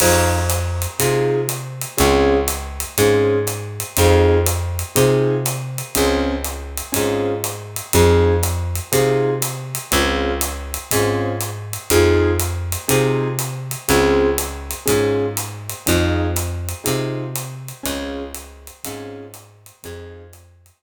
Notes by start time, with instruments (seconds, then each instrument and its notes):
0.00 electric bass (finger) F2, acoustic grand piano C4 D#4 F4 G#4, kick, crash, ride
0.49 hi-hat pedal, ride
0.82 ride
0.99 electric bass (finger) C3, acoustic grand piano C4 D#4 F4 G#4, kick, ride
1.49 hi-hat pedal, ride
1.81 ride
1.97 electric bass (finger) C#2, acoustic grand piano C4 C#4 F4 G#4, kick, ride
2.48 hi-hat pedal, ride
2.80 ride
2.98 electric bass (finger) G#2, acoustic grand piano C4 C#4 F4 G#4, kick, ride
3.47 hi-hat pedal, ride
3.80 ride
3.97 electric bass (finger) F2, acoustic grand piano C4 D#4 F4 G#4, kick, ride
4.46 hi-hat pedal, ride
4.79 ride
4.95 electric bass (finger) C3, acoustic grand piano C4 D#4 F4 G#4, kick, ride
5.46 hi-hat pedal, ride
5.78 ride
5.95 electric bass (finger) C#2, acoustic grand piano C4 C#4 F4 G#4, kick, ride
6.44 hi-hat pedal, ride
6.77 ride
6.92 electric bass (finger) G#2, acoustic grand piano C4 C#4 F4 G#4, kick, ride
7.44 hi-hat pedal, ride
7.76 ride
7.93 electric bass (finger) F2, acoustic grand piano C4 D#4 F4 G#4, kick, ride
8.43 hi-hat pedal, ride
8.75 ride
8.92 electric bass (finger) C3, acoustic grand piano C4 D#4 F4 G#4, kick, ride
9.42 hi-hat pedal, ride
9.75 ride
9.91 electric bass (finger) C#2, acoustic grand piano C4 C#4 F4 G#4, kick, ride
10.41 hi-hat pedal, ride
10.74 ride
10.91 electric bass (finger) G#2, acoustic grand piano C4 C#4 F4 G#4, kick, ride
11.41 hi-hat pedal, ride
11.73 ride
11.90 electric bass (finger) F2, acoustic grand piano C4 D#4 F4 G#4, kick, ride
12.39 hi-hat pedal, ride
12.72 ride
12.88 electric bass (finger) C3, acoustic grand piano C4 D#4 F4 G#4, kick, ride
13.39 hi-hat pedal, ride
13.71 ride
13.88 electric bass (finger) C#2, acoustic grand piano C4 C#4 F4 G#4, kick, ride
14.38 hi-hat pedal, ride
14.71 ride
14.86 electric bass (finger) G#2, acoustic grand piano C4 C#4 F4 G#4, kick, ride
15.37 hi-hat pedal, ride
15.69 ride
15.86 electric bass (finger) F2, acoustic grand piano C4 D#4 F4 G#4, kick, ride
16.36 hi-hat pedal, ride
16.69 ride
16.84 electric bass (finger) C3, acoustic grand piano C4 D#4 F4 G#4, kick, ride
17.35 hi-hat pedal, ride
17.68 ride
17.83 electric bass (finger) C#2, acoustic grand piano C4 C#4 F4 G#4, kick, ride
18.35 hi-hat pedal, ride
18.67 ride
18.84 electric bass (finger) G#2, acoustic grand piano C4 C#4 F4 G#4, kick, ride
19.34 hi-hat pedal, ride
19.66 ride
19.83 electric bass (finger) F2, acoustic grand piano C4 D#4 F4 G#4, kick, ride
20.33 hi-hat pedal, ride
20.66 ride